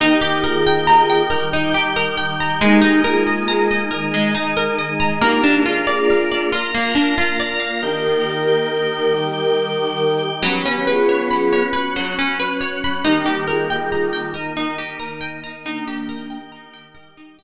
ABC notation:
X:1
M:3/4
L:1/16
Q:1/4=69
K:Eb
V:1 name="Flute"
[EG]2 [FA]4 z6 | [EG]2 [FA]4 z6 | [EG]2 [FA]4 z6 | [GB]12 |
G2 [FA]4 z6 | [EG]2 [FA]4 z6 | [B,D]4 z8 |]
V:2 name="Orchestral Harp"
E G B g b g B E G B g b | A, E B e b e B A, E B e b | B, D F d f d F B, D F d f | z12 |
_G, _D _c _d _c' d c G, D c d c' | E G B g b g B E G B g b | E G B g b g B E G z3 |]
V:3 name="Drawbar Organ"
[E,B,G]6 [E,G,G]6 | [A,B,E]6 [E,A,E]6 | [B,DF]6 [B,FB]6 | [E,B,G]6 [E,G,G]6 |
[_G,_C_D]6 [G,D_G]6 | [E,G,B,]6 [E,B,E]6 | [E,B,G]6 [E,G,G]6 |]